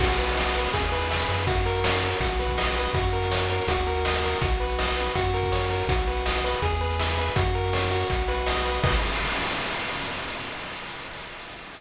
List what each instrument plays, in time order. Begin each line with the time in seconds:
0.00 synth bass 1 B1, lead 1 (square) F#4, kick, crash
0.09 closed hi-hat
0.18 lead 1 (square) B4, closed hi-hat
0.28 closed hi-hat
0.37 lead 1 (square) D#5, snare
0.46 closed hi-hat
0.55 lead 1 (square) B4, closed hi-hat
0.64 closed hi-hat
0.73 synth bass 1 E2, lead 1 (square) G#4, kick, closed hi-hat
0.83 closed hi-hat
0.92 lead 1 (square) B4, closed hi-hat
1.01 closed hi-hat
1.10 lead 1 (square) E5, snare
1.20 closed hi-hat
1.29 synth bass 1 F#2, lead 1 (square) B4, closed hi-hat
1.38 closed hi-hat
1.47 lead 1 (square) F#4, kick, closed hi-hat
1.56 closed hi-hat
1.66 lead 1 (square) A#4, closed hi-hat
1.75 closed hi-hat
1.84 lead 1 (square) C#5, snare
1.93 closed hi-hat
2.02 lead 1 (square) A#4, closed hi-hat
2.11 closed hi-hat
2.20 synth bass 1 B1, lead 1 (square) F#4, kick, closed hi-hat
2.30 closed hi-hat
2.39 lead 1 (square) B4, closed hi-hat
2.48 kick, closed hi-hat
2.58 lead 1 (square) D#5, snare
2.67 closed hi-hat
2.76 lead 1 (square) B4, closed hi-hat
2.85 closed hi-hat
2.93 synth bass 1 F#2, lead 1 (square) F#4, kick, closed hi-hat
3.04 closed hi-hat
3.13 lead 1 (square) A#4, closed hi-hat
3.22 closed hi-hat
3.31 lead 1 (square) C#5, snare
3.40 closed hi-hat
3.50 lead 1 (square) A#4, closed hi-hat
3.59 closed hi-hat
3.68 synth bass 1 D#2, lead 1 (square) F#4, kick, closed hi-hat
3.77 closed hi-hat
3.87 lead 1 (square) A#4, closed hi-hat
3.96 closed hi-hat
4.05 lead 1 (square) D#5, snare
4.14 closed hi-hat
4.23 lead 1 (square) A#4, closed hi-hat
4.33 closed hi-hat
4.41 synth bass 1 B1, lead 1 (square) F#4, kick, closed hi-hat
4.51 closed hi-hat
4.60 lead 1 (square) B4, closed hi-hat
4.69 closed hi-hat
4.79 lead 1 (square) D#5, snare
4.88 closed hi-hat
4.97 lead 1 (square) B4, closed hi-hat
5.06 closed hi-hat
5.15 synth bass 1 F#2, lead 1 (square) F#4, kick, closed hi-hat
5.24 closed hi-hat
5.34 lead 1 (square) A#4, closed hi-hat
5.43 kick, closed hi-hat
5.52 lead 1 (square) C#5, snare
5.61 closed hi-hat
5.70 lead 1 (square) A#4, closed hi-hat
5.80 closed hi-hat
5.87 synth bass 1 B1, lead 1 (square) F#4, kick, closed hi-hat
5.98 closed hi-hat
6.07 lead 1 (square) B4, closed hi-hat
6.17 closed hi-hat
6.26 lead 1 (square) D#5, snare
6.35 closed hi-hat
6.44 lead 1 (square) B4, closed hi-hat
6.53 closed hi-hat
6.62 synth bass 1 E2, lead 1 (square) G#4, kick, closed hi-hat
6.72 closed hi-hat
6.81 lead 1 (square) B4, closed hi-hat
6.90 closed hi-hat
6.99 lead 1 (square) E5, snare
7.09 closed hi-hat
7.18 lead 1 (square) B4, closed hi-hat
7.27 closed hi-hat
7.36 synth bass 1 F#2, lead 1 (square) F#4, kick, closed hi-hat
7.45 closed hi-hat
7.54 lead 1 (square) A#4, closed hi-hat
7.64 closed hi-hat
7.73 lead 1 (square) C#5, snare
7.82 closed hi-hat
7.91 lead 1 (square) F#4, closed hi-hat
8.00 closed hi-hat
8.10 synth bass 1 B1, kick, closed hi-hat
8.19 closed hi-hat
8.28 lead 1 (square) B4, closed hi-hat
8.37 closed hi-hat
8.46 lead 1 (square) D#5, snare
8.56 closed hi-hat
8.65 lead 1 (square) B4, closed hi-hat
8.74 closed hi-hat
8.84 synth bass 1 B1, lead 1 (square) F#4 B4 D#5, kick, crash